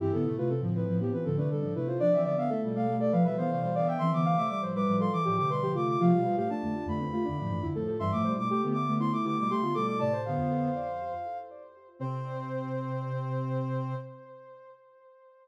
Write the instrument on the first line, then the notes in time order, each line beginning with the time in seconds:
ocarina
0.00 G2 E3 C4 E4 G4
0.12 A2 D3 B3 A4
0.25 C3 A3 E4
0.37 C3 A3 F4 B4
0.48 C3 C4 A4
0.61 A2 D3 F3
0.75 B4
0.88 A2 F3
1.00 F3 B3 G4
1.12 E3 C4 B4
1.24 A2 D3 F3 C4 A4
1.37 C3 A3 D4 B4
1.50 B2 D3 G3 A4
1.62 A2 F3 D4
1.75 C3 A3 E4 B4
1.87 F4 C5
1.99 F3 D4 D5
2.12 E3 F3 C4 E5
2.23 D3 B3 D5
2.38 D3 B3 E5 F5
2.49 A3 A4 E5
2.63 B2 G3
2.75 A3 F5
2.88 B2 G3 A3
3.00 A4 D5
3.12 F3 B4 F5
3.24 B2 F3 G3 B4 E5
3.37 D3 E3 B3 C5 F5
3.51 C3 A3 F5
3.61 B2 G3 C5
3.75 D3 B3 D5 F5
3.87 E5 G5
3.98 E3 C4 E5 C6
4.12 D3 E3 B3 D6
4.25 C3 A3 F5
4.37 C3 A3 E5 D6
4.49 G3 D6
4.61 A2 F3 C5
4.75 G3 B4 D6
4.86 A2 F3 G3
5.00 A4 C6
5.12 E3 D6
5.25 A2 E3 F3 G4 D6
5.36 C3 D3 A3 G4 D6
5.50 B2 G3 B4 C6
5.60 A2 F3 G4
5.74 C3 A3 F4 D6
5.88 D6
6.00 C3 F3 A3 F4 F5
6.12 B2 G3
6.24 A2 F3 F4
6.36 A2 F3 A3 G4 F5
6.50 A3 D4 A5
6.62 F2 D3 A3
6.86 F2 D3 A3 B5
7.00 A3 C4
7.13 A3 F4
7.25 F2 D3 A3 D4
7.38 A2 F3 D4
7.49 G2 E3 A3
7.62 F2 D3 E4
7.75 A2 F3 A3 A4
7.88 A4
7.99 G2 E3 G3 E5 C6
8.12 A2 F3 A3 D6
8.24 B2 G3 C5
8.37 B2 G3 A3 D6
8.49 A3 G4 D6
8.62 D3 A3 B3
8.73 D6
8.87 D3 A3 B3
9.00 A3 E4 C6
9.12 A3 E4 D6
9.23 D3 A3 B3 E4 D6
9.39 B2 G3 D6
9.48 C3 A3 G4 C6
9.61 D3 B3 F4
9.74 B2 G3 A3 A4 D6
9.87 D6
9.99 A2 C3 A3 D5 A5
10.13 C5
10.25 D3 B3 F5
10.37 F2
11.99 C3 C4 C5